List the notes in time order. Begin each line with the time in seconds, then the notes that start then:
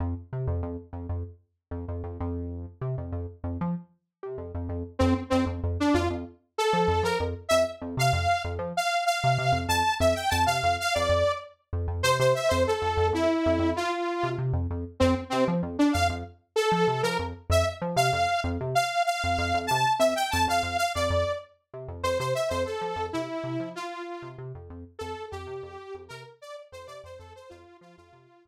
0.00 F2
0.33 C3
0.47 F2
0.63 F2
0.93 F2
1.09 F2
1.71 F2
1.88 F2
2.04 F2
2.20 F2
2.81 C3
2.98 F2
3.12 F2
3.44 F2
3.61 F3
4.23 C3
4.38 F2
4.55 F2
4.69 F2
4.99 F2 C4
5.30 F2 C4
5.46 F2
5.64 F2
5.80 D4
5.94 F2 F4
6.10 F2
6.58 A4
6.73 F3
6.88 F2
7.03 F3 A#4
7.20 F2
7.49 F2 E5
7.82 F2
7.97 C3 F5
8.13 F2
8.45 F2
8.59 F3
8.77 F5
9.06 F5
9.24 C3
9.38 C3
9.52 F2
9.68 F2 A5
10.00 F2 E5
10.15 G5
10.30 F2 A5
10.46 C3 F5
10.63 F2
10.80 F5
10.94 F2 D5
11.09 F2
11.73 F2
11.88 F2
12.03 C3 C5
12.19 C3 C5
12.35 E5
12.49 F2 C5
12.67 A4
12.82 F2
12.97 F2
13.13 F2 E4
13.46 F2
13.59 F2
13.76 F4
14.23 C3
14.38 C3
14.53 F2
14.70 F2
15.00 F2 C4
15.30 C3 C4
15.48 F3
15.63 F2
15.79 D4
15.93 F2 F5
16.09 F2
16.56 A4
16.72 F3
16.88 C3
17.03 F3 A#4
17.19 F2
17.50 F2 E5
17.82 F3
17.96 C3 F5
18.13 F2
18.44 F2
18.61 C3
18.75 F5
19.06 F5
19.24 F2
19.38 F2
19.54 F2
19.67 A5
19.71 C3
19.99 F2 E5
20.15 G5
20.31 F2 A5
20.48 F2 F5
20.63 F2
20.78 F5
20.95 F2 D5
21.10 F2
21.74 C3
21.88 F2
22.03 F2 C5
22.19 C3 C5
22.35 E5
22.49 F2 C5
22.65 A4
22.81 F3
22.96 F2
23.13 C3 E4
23.44 C3
23.60 F3
23.75 F4
24.22 C3
24.38 C3
24.55 F2
24.70 F2
24.99 F2 A4
25.31 F2 G4
25.47 C3
25.63 F2
25.94 F2
26.08 C3 A#4
26.42 D5
26.72 F2 C5
26.86 C3 D5
27.04 F2 C5
27.18 F2 A4
27.36 C5
27.49 F2 F4
27.81 F3 F4
27.97 F2 F4
28.13 C3
28.45 F2